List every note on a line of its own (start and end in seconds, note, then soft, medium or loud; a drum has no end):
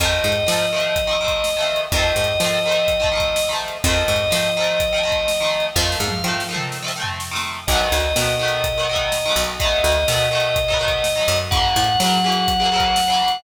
0.00 0.20 F2 loud
0.00 0.38 D#3 loud
0.00 0.38 F3 loud
0.00 0.38 A3 loud
0.00 1.81 D#5 loud
0.00 kick medium
0.00 closed hi-hat medium
0.05 0.38 C4 loud
0.24 0.44 G#2 medium
0.32 closed hi-hat medium
0.47 0.66 D#3 medium
0.47 1.70 F3 medium
0.47 0.66 F3 loud
0.47 0.66 A3 medium
0.47 snare loud
0.52 0.66 C4 medium
0.72 1.01 D#3 medium
0.72 1.01 F3 medium
0.72 1.01 A3 medium
0.78 1.01 C4 medium
0.78 closed hi-hat medium
0.96 kick medium
0.96 closed hi-hat medium
1.07 1.17 D#3 medium
1.07 1.17 F3 medium
1.07 1.17 A3 medium
1.13 1.17 C4 medium
1.21 1.49 D#3 medium
1.21 1.49 F3 medium
1.21 1.49 A3 medium
1.26 1.49 C4 medium
1.26 kick medium
1.26 closed hi-hat medium
1.44 snare medium
1.57 1.85 D#3 medium
1.57 1.85 F3 medium
1.57 1.85 A3 medium
1.62 1.85 C4 medium
1.76 closed hi-hat medium
1.92 2.12 F2 loud
1.92 2.31 D#3 medium
1.92 2.31 F3 loud
1.92 3.50 D#5 loud
1.92 kick loud
1.92 closed hi-hat medium
1.97 2.31 A3 medium
1.97 2.31 C4 loud
2.16 2.36 G#2 medium
2.24 closed hi-hat medium
2.40 2.59 D#3 loud
2.40 3.62 F3 medium
2.40 2.59 F3 medium
2.40 snare medium
2.44 2.59 A3 loud
2.44 2.59 C4 loud
2.66 2.94 D#3 medium
2.66 2.94 F3 medium
2.66 2.94 A3 medium
2.71 2.94 C4 medium
2.71 closed hi-hat medium
2.88 kick medium
2.88 closed hi-hat medium
3.00 3.09 D#3 medium
3.00 3.09 F3 medium
3.00 3.09 A3 medium
3.04 3.09 C4 medium
3.04 kick medium
3.12 3.40 D#3 medium
3.12 3.40 F3 medium
3.12 3.40 A3 medium
3.17 3.40 C4 medium
3.17 kick medium
3.17 closed hi-hat medium
3.36 snare loud
3.49 3.78 D#3 medium
3.49 3.78 F3 medium
3.49 3.78 A3 medium
3.54 3.78 C4 medium
3.68 closed hi-hat medium
3.84 4.04 F2 loud
3.84 4.23 D#3 loud
3.84 4.23 F3 loud
3.84 5.66 D#5 loud
3.84 kick loud
3.84 closed hi-hat medium
3.88 4.23 A3 medium
3.88 4.23 C4 medium
4.08 4.28 G#2 medium
4.16 closed hi-hat medium
4.30 4.50 D#3 medium
4.30 5.54 F3 medium
4.30 4.50 F3 medium
4.30 4.50 A3 medium
4.30 snare medium
4.36 4.50 C4 medium
4.57 4.86 D#3 loud
4.57 4.86 F3 medium
4.57 4.86 A3 medium
4.62 4.86 C4 medium
4.62 closed hi-hat medium
4.80 kick medium
4.80 closed hi-hat medium
4.92 5.02 D#3 medium
4.92 5.02 F3 medium
4.92 5.02 A3 medium
4.98 5.02 C4 medium
5.03 5.32 D#3 medium
5.03 5.32 F3 medium
5.03 5.32 A3 medium
5.09 5.32 C4 medium
5.09 kick medium
5.09 closed hi-hat medium
5.28 snare medium
5.40 5.69 D#3 medium
5.40 5.69 F3 medium
5.40 5.69 A3 medium
5.46 5.69 C4 medium
5.60 closed hi-hat medium
5.75 5.96 F2 loud
5.75 6.14 D#3 medium
5.75 6.14 F3 loud
5.75 6.45 F5 loud
5.75 kick medium
5.75 snare medium
5.79 6.14 A3 loud
5.79 6.14 C4 loud
5.92 snare medium
6.00 6.20 G#2 medium
6.08 high tom medium
6.24 6.43 D#3 medium
6.24 7.46 F3 medium
6.24 6.43 F3 medium
6.24 6.43 A3 medium
6.30 6.43 C4 medium
6.40 snare medium
6.49 6.78 D#3 medium
6.49 6.78 F3 medium
6.49 6.78 A3 medium
6.54 6.78 C4 loud
6.54 mid tom medium
6.72 snare medium
6.83 6.92 D#3 medium
6.83 6.92 F3 medium
6.83 6.92 A3 medium
6.88 6.92 C4 medium
6.88 snare medium
6.96 7.25 D#3 medium
6.96 7.25 F3 medium
6.96 7.25 A3 medium
7.02 7.25 C4 loud
7.02 floor tom medium
7.20 snare medium
7.31 7.60 D#3 medium
7.31 7.60 F3 medium
7.31 7.60 A3 medium
7.36 7.60 C4 medium
7.36 snare medium
7.67 7.88 B1 loud
7.67 8.08 D#3 loud
7.67 9.42 D#5 loud
7.67 kick medium
7.67 crash medium
7.71 8.08 F#3 loud
7.71 8.08 A3 loud
7.71 8.08 B3 loud
7.92 8.12 D2 medium
8.00 closed hi-hat medium
8.16 9.30 B2 medium
8.16 8.35 D#3 medium
8.16 8.35 F#3 medium
8.16 8.35 A3 medium
8.16 snare loud
8.22 8.35 B3 medium
8.39 8.68 D#3 medium
8.39 8.68 F#3 medium
8.39 8.68 A3 loud
8.45 8.68 B3 medium
8.45 closed hi-hat medium
8.64 kick medium
8.64 closed hi-hat medium
8.78 8.87 D#3 medium
8.78 8.87 F#3 medium
8.78 8.87 A3 medium
8.83 8.87 B3 medium
8.89 9.18 D#3 medium
8.89 9.18 F#3 medium
8.89 9.18 A3 loud
8.95 9.18 B3 medium
8.95 kick medium
8.95 closed hi-hat medium
9.12 snare medium
9.26 9.54 D#3 medium
9.26 9.54 F#3 medium
9.26 9.54 A3 medium
9.31 9.54 B3 loud
9.36 9.80 B1 loud
9.44 closed hi-hat medium
9.60 9.98 D#3 loud
9.60 9.98 F#3 loud
9.60 9.98 A3 loud
9.60 11.38 D#5 loud
9.60 kick medium
9.60 closed hi-hat medium
9.65 9.98 B3 loud
9.84 10.04 D2 medium
9.92 closed hi-hat medium
10.08 11.22 B2 medium
10.08 10.28 D#3 medium
10.08 10.28 F#3 medium
10.08 snare loud
10.13 10.28 A3 medium
10.13 10.28 B3 medium
10.31 10.60 D#3 medium
10.31 10.60 F#3 loud
10.31 10.60 A3 loud
10.37 10.60 B3 medium
10.37 closed hi-hat medium
10.56 kick medium
10.56 closed hi-hat medium
10.68 10.78 D#3 medium
10.68 10.78 F#3 loud
10.68 10.78 A3 medium
10.68 kick medium
10.74 10.78 B3 medium
10.79 11.08 D#3 medium
10.79 11.08 F#3 loud
10.79 11.08 A3 medium
10.85 11.08 B3 medium
10.85 kick medium
10.85 closed hi-hat medium
11.04 snare medium
11.15 11.44 D#3 medium
11.15 11.44 F#3 medium
11.15 11.44 A3 medium
11.21 11.44 B3 loud
11.28 11.72 F#2 loud
11.36 closed hi-hat medium
11.51 11.89 C#3 loud
11.51 11.89 E3 loud
11.51 13.37 F#5 loud
11.51 kick loud
11.51 closed hi-hat medium
11.55 11.89 F#3 loud
11.55 11.89 A#3 loud
11.76 11.96 A2 medium
11.84 closed hi-hat medium
12.00 12.19 C#3 medium
12.00 12.19 E3 medium
12.00 13.22 F#3 medium
12.00 12.19 F#3 medium
12.00 snare loud
12.06 12.19 A#3 loud
12.24 12.53 C#3 medium
12.24 12.53 E3 loud
12.24 12.53 F#3 medium
12.30 12.53 A#3 medium
12.30 closed hi-hat medium
12.48 kick medium
12.48 closed hi-hat medium
12.60 12.69 C#3 medium
12.60 12.69 E3 medium
12.60 12.69 F#3 medium
12.65 12.69 A#3 medium
12.72 13.01 C#3 medium
12.72 13.01 E3 medium
12.72 13.01 F#3 loud
12.77 13.01 A#3 medium
12.77 kick medium
12.77 closed hi-hat medium
12.96 snare medium
13.08 13.37 C#3 medium
13.08 13.37 E3 medium
13.08 13.37 F#3 medium
13.13 13.37 A#3 medium
13.28 closed hi-hat medium